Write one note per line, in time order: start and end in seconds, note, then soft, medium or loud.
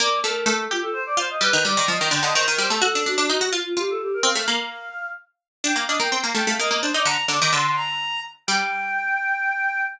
0.00 0.22 A#3 loud
0.00 0.19 D5 medium
0.24 0.45 A3 medium
0.24 0.47 A#4 medium
0.46 0.67 A3 loud
0.46 0.65 A4 medium
0.71 0.83 F4 medium
0.71 1.16 G4 loud
0.83 0.94 A4 medium
0.93 1.04 C5 medium
1.06 1.17 D5 medium
1.17 1.38 F4 loud
1.17 1.29 C5 medium
1.30 1.41 D#5 medium
1.41 1.52 G3 loud
1.41 1.62 B4 loud
1.53 1.64 D#3 loud
1.65 1.76 G3 loud
1.65 1.86 D5 medium
1.77 1.88 D#3 loud
1.88 1.99 F3 loud
1.88 2.08 D#5 medium
2.01 2.12 D#3 medium
2.11 2.22 D3 loud
2.11 2.23 G5 medium
2.23 2.34 D3 loud
2.23 2.35 D#5 medium
2.34 2.46 D#3 loud
2.34 2.45 C5 medium
2.46 2.59 D#3 loud
2.46 2.57 A#4 medium
2.58 2.70 G3 loud
2.58 2.70 C5 medium
2.69 2.81 A3 loud
2.69 2.81 A4 medium
2.82 2.93 F#4 loud
2.82 3.03 A4 loud
2.95 3.06 D4 loud
3.06 3.17 D4 loud
3.06 3.28 F#4 medium
3.18 3.29 D4 loud
3.28 3.41 D#4 loud
3.28 3.48 F#4 medium
3.41 3.52 F#4 loud
3.52 3.63 F4 medium
3.52 3.74 F4 loud
3.66 3.78 F4 medium
3.77 4.22 F4 loud
3.77 3.89 G4 medium
3.90 4.01 A4 medium
4.01 4.13 G4 medium
4.14 4.25 A#4 medium
4.23 4.34 C4 loud
4.23 4.44 F5 loud
4.35 4.47 A3 loud
4.48 4.89 A#3 loud
4.48 5.06 F5 medium
5.64 5.75 D4 loud
5.64 5.76 G5 medium
5.76 5.87 A#3 medium
5.76 5.88 F5 medium
5.88 6.00 D4 loud
5.88 5.99 D#5 medium
6.00 6.11 A#3 loud
6.00 6.12 G5 medium
6.12 6.23 C4 loud
6.24 6.35 A#3 loud
6.24 6.35 F5 medium
6.35 6.46 A3 loud
6.35 6.46 G5 medium
6.47 6.58 A3 loud
6.47 6.60 F5 medium
6.59 6.70 A#3 medium
6.59 6.69 D#5 medium
6.70 6.82 A#3 loud
6.70 6.81 D#5 medium
6.81 6.94 D4 loud
6.81 6.92 C5 medium
6.94 7.06 D#4 loud
6.94 7.06 D5 medium
7.05 7.17 D3 loud
7.05 7.26 A#5 loud
7.28 7.40 D3 medium
7.28 7.41 D6 medium
7.42 7.53 D#3 loud
7.42 7.53 D6 medium
7.53 8.36 D3 loud
7.53 7.76 C6 medium
7.76 8.20 A#5 medium
8.47 9.82 G3 loud
8.47 9.81 G5 loud